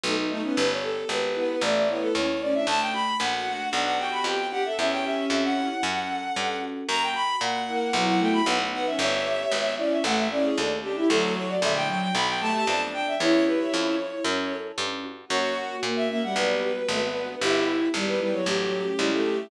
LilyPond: <<
  \new Staff \with { instrumentName = "Violin" } { \time 4/4 \key b \minor \partial 4 \tempo 4 = 114 dis'8 dis'16 cis'16 | b'16 cis''16 a'8 b'4 d''16 d''16 cis''16 a'16 cis''8 d''16 e''16 | a''16 g''16 b''8 fis''4 fis''16 fis''16 g''16 b''16 g''8 fis''16 e''16 | e''16 g''16 e''8 e''16 fis''2~ fis''16 r8 |
ais''16 g''16 b''8 fis''4 fis''16 fis''16 g''16 b''16 fis''8 fis''16 e''16 | <cis'' e''>4. d''16 e''16 fis''16 e''16 d''16 gis'16 a'8 g'16 g'16 | a'8 cis''16 d''16 e''16 g''16 g''16 g''16 b''16 g''16 a''16 a''16 a''16 r16 g''16 e''16 | cis''8 b'16 cis''2~ cis''16 r4 |
cis''8 r8. e''16 e''16 fis''16 b'2 | g'8 r8. b'16 b'16 cis''16 g'2 | }
  \new Staff \with { instrumentName = "Violin" } { \time 4/4 \key b \minor \partial 4 a16 r16 a16 b16 | r4. b8 a8 b8 cis'16 r16 cis'16 d'16 | r4. fis'8 d'8 fis'8 g'16 r16 g'16 a'16 | cis'2 r2 |
r4. ais8 fis8 a8 b16 r16 b16 cis'16 | r4. cis'8 a8 cis'8 d'16 r16 d'16 e'16 | fis4 d8 fis8 r8 a8 d'4 | e'4. r2 r8 |
fis'4 ais8 ais16 g4 r16 a16 b8. | e'4 g8 g16 fis4 r16 g16 a8. | }
  \new Staff \with { instrumentName = "Electric Piano 1" } { \time 4/4 \key b \minor \partial 4 b8 dis'8 | b8 g'8 b8 e'8 a8 e'8 a8 cis'8 | a8 fis'8 a8 d'8 b8 g'8 b8 d'8 | cis'8 g'8 cis'8 e'8 cis'8 a'8 cis'8 fis'8 |
ais8 fis'8 ais8 e'8 <b e' fis'>4 b8 dis'8 | b8 g'8 b8 e'8 a8 e'8 a8 cis'8 | a8 fis'8 a8 d'8 b8 g'8 b8 d'8 | cis'8 g'8 cis'8 e'8 cis'8 a'8 cis'8 fis'8 |
ais8 fis'8 ais8 cis'8 b8 fis'8 b8 d'8 | b8 g'8 b8 e'8 a8 cis'8 e'8 g'8 | }
  \new Staff \with { instrumentName = "Harpsichord" } { \clef bass \time 4/4 \key b \minor \partial 4 b,,4 | g,,4 gis,,4 a,,4 dis,4 | d,4 ais,,4 b,,4 f,4 | e,4 f,4 fis,4 g,4 |
fis,4 ais,4 b,,4 b,,4 | g,,4 gis,,4 a,,4 dis,4 | d,4 ais,,4 b,,4 f,4 | e,4 f,4 fis,4 g,4 |
fis,4 ais,4 b,,4 gis,,4 | g,,4 gis,,4 a,,4 cis,4 | }
>>